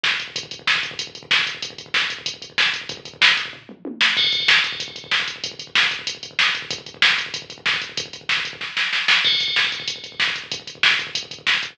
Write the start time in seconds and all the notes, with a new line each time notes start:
0.04 kick, snare
0.11 kick
0.20 kick, closed hi-hat
0.28 kick
0.36 kick, closed hi-hat
0.43 kick
0.51 kick, closed hi-hat
0.59 kick
0.67 kick, snare
0.75 kick
0.83 kick, closed hi-hat
0.91 kick
0.99 kick, closed hi-hat
1.07 kick
1.15 kick, closed hi-hat
1.23 kick
1.31 kick, snare
1.39 kick
1.47 kick, closed hi-hat
1.55 kick
1.62 kick, closed hi-hat
1.70 kick
1.78 kick, closed hi-hat
1.86 kick
1.94 kick, snare
2.02 kick
2.10 kick, closed hi-hat
2.19 kick
2.26 kick, closed hi-hat
2.34 kick
2.42 kick, closed hi-hat
2.50 kick
2.58 kick, snare
2.66 kick
2.73 kick, closed hi-hat
2.81 kick
2.89 kick, closed hi-hat
2.97 kick
3.05 kick, closed hi-hat
3.14 kick
3.21 kick, snare
3.29 kick
3.37 kick, closed hi-hat
3.46 kick
3.53 kick, floor tom
3.69 mid tom
3.85 high tom
4.01 snare
4.17 kick, crash
4.24 kick
4.32 kick, closed hi-hat
4.40 kick
4.48 kick, snare
4.56 kick
4.64 kick, closed hi-hat
4.72 kick
4.80 kick, closed hi-hat
4.88 kick
4.96 kick, closed hi-hat
5.04 kick
5.11 kick, snare
5.20 kick
5.28 kick, closed hi-hat
5.36 kick
5.44 kick, closed hi-hat
5.52 kick
5.59 kick, closed hi-hat
5.67 kick
5.75 kick, snare
5.83 kick
5.91 kick, closed hi-hat
5.99 kick
6.07 kick, closed hi-hat
6.15 kick
6.23 kick, closed hi-hat
6.31 kick
6.39 kick, snare
6.47 kick
6.55 kick, closed hi-hat
6.62 kick
6.71 kick, closed hi-hat
6.78 kick
6.86 kick, closed hi-hat
6.94 kick
7.02 kick, snare
7.10 kick
7.18 kick, closed hi-hat
7.26 kick
7.34 kick, closed hi-hat
7.42 kick
7.50 kick, closed hi-hat
7.58 kick
7.66 kick, snare
7.74 kick
7.82 kick, closed hi-hat
7.89 kick
7.97 kick, closed hi-hat
8.06 kick
8.13 kick, closed hi-hat
8.21 kick
8.29 kick, snare
8.37 kick
8.45 kick, closed hi-hat
8.53 kick
8.61 kick, snare
8.77 snare
8.93 snare
9.08 snare
9.24 kick, crash
9.32 kick
9.40 kick, closed hi-hat
9.48 kick
9.56 kick, snare
9.64 kick
9.72 kick, closed hi-hat
9.80 kick
9.88 kick, closed hi-hat
9.96 kick
10.04 kick, closed hi-hat
10.12 kick
10.20 kick, snare
10.28 kick
10.36 kick, closed hi-hat
10.44 kick
10.52 kick, closed hi-hat
10.60 kick
10.67 kick, closed hi-hat
10.75 kick
10.83 kick, snare
10.91 kick
10.99 kick, closed hi-hat
11.07 kick
11.15 kick, closed hi-hat
11.23 kick
11.31 kick, closed hi-hat
11.39 kick
11.47 kick, snare
11.54 kick
11.63 kick, closed hi-hat
11.71 kick